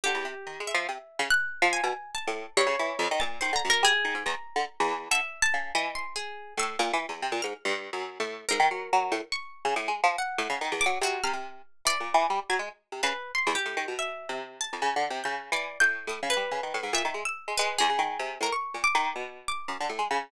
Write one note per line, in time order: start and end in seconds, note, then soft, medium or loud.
0.04 0.15 D3 medium
0.04 0.61 G4 medium
0.15 0.24 E2 medium
0.25 0.34 C3 medium
0.47 0.59 D#3 medium
0.60 0.73 G#3 medium
0.67 1.24 E5 medium
0.74 0.87 F3 loud
0.89 0.98 C3 medium
1.19 1.29 C#3 loud
1.30 1.68 F#6 loud
1.62 1.81 F3 loud
1.73 2.11 G#5 medium
1.84 1.93 B2 medium
2.15 2.53 A5 medium
2.27 2.46 A2 medium
2.57 2.66 G2 loud
2.57 3.14 C#5 medium
2.67 2.76 C#3 loud
2.79 2.99 E3 loud
2.99 3.08 F2 loud
3.11 3.21 D#3 loud
3.20 3.40 A#2 medium
3.20 3.39 A6 medium
3.41 3.51 D#3 loud
3.41 3.53 C5 medium
3.53 3.62 D3 medium
3.53 3.68 A#5 medium
3.65 3.84 F#2 medium
3.70 3.83 A#4 medium
3.83 3.92 G3 medium
3.83 4.23 G#4 loud
4.05 4.14 D#3 medium
4.15 4.24 G#2 medium
4.26 4.35 E2 medium
4.26 5.02 A#5 medium
4.56 4.65 D3 loud
4.80 5.09 E2 loud
5.11 5.21 D3 medium
5.11 5.40 E5 medium
5.42 5.71 A5 loud
5.54 5.73 C#3 medium
5.75 6.32 E3 loud
5.75 5.94 D#5 medium
5.95 6.14 C6 medium
6.16 6.54 G#4 medium
6.57 6.76 A2 loud
6.57 7.36 E6 loud
6.79 6.92 A#2 loud
6.93 7.06 E3 medium
7.09 7.22 E2 medium
7.22 7.32 C3 medium
7.32 7.41 A#2 medium
7.42 7.53 G#2 medium
7.42 7.61 F6 medium
7.65 7.90 G2 loud
7.93 8.18 F#2 medium
8.20 8.45 A2 medium
8.49 8.60 G#2 medium
8.49 9.25 A#4 medium
8.60 8.69 D#3 loud
8.71 8.90 F#3 medium
8.93 9.12 F#3 loud
9.12 9.21 A2 medium
9.32 10.08 C#6 medium
9.65 9.74 C#3 loud
9.76 9.89 A2 medium
9.88 10.01 G#3 medium
10.04 10.16 F3 loud
10.18 10.75 F#5 medium
10.38 10.48 A2 loud
10.50 10.59 C#3 medium
10.61 10.74 D#3 loud
10.72 10.85 E2 medium
10.81 11.00 D6 loud
10.86 10.99 F#3 medium
11.01 11.21 C3 medium
11.01 11.22 F#4 medium
11.24 11.33 C3 medium
11.24 11.81 F6 loud
11.33 11.62 C3 medium
11.85 11.98 E3 medium
11.85 12.44 D5 loud
12.00 12.13 A#2 medium
12.14 12.27 E3 loud
12.30 12.40 G3 medium
12.50 12.59 F#3 medium
12.50 12.69 G#6 medium
12.59 12.69 G#3 medium
12.92 13.02 C3 medium
13.03 13.13 C#3 loud
13.03 13.31 B4 medium
13.35 13.54 C6 medium
13.47 13.56 E2 medium
13.55 13.93 G4 medium
13.66 13.75 A2 medium
13.77 13.86 D#3 medium
13.88 14.26 B2 medium
13.99 14.37 E5 medium
14.29 14.67 C3 medium
14.61 15.18 A5 medium
14.73 14.82 F2 medium
14.82 14.95 C#3 loud
14.96 15.09 D3 medium
15.10 15.23 C3 medium
15.24 15.50 C#3 medium
15.24 15.49 G6 soft
15.52 15.77 E3 medium
15.52 15.78 D5 medium
15.80 16.06 A2 medium
15.80 16.06 G6 loud
16.07 16.20 A2 medium
16.07 16.28 D#6 medium
16.23 16.35 C#3 medium
16.30 16.87 B4 medium
16.37 16.49 G3 medium
16.51 16.61 C#3 medium
16.63 16.73 D#3 medium
16.74 16.84 A2 medium
16.83 16.93 G#2 medium
16.93 17.03 A#2 medium
16.93 17.23 E5 medium
17.05 17.14 D#3 medium
17.14 17.24 G#3 medium
17.25 17.54 E6 medium
17.48 17.57 G#3 medium
17.57 17.78 G#3 loud
17.57 17.76 B4 medium
17.78 17.90 E2 medium
17.78 18.35 G#4 medium
17.90 17.99 C#3 medium
17.99 18.18 D#3 medium
18.19 18.38 C3 medium
18.41 18.50 A2 medium
18.41 18.52 A#4 medium
18.52 18.81 C#6 medium
18.74 18.84 A#2 medium
18.84 19.41 D6 loud
18.95 19.14 D#3 loud
19.16 19.63 B2 medium
19.48 20.24 D6 medium
19.68 19.78 F#2 medium
19.80 19.90 D3 medium
19.90 19.99 A2 medium
19.99 20.08 G#3 medium
20.11 20.30 C#3 loud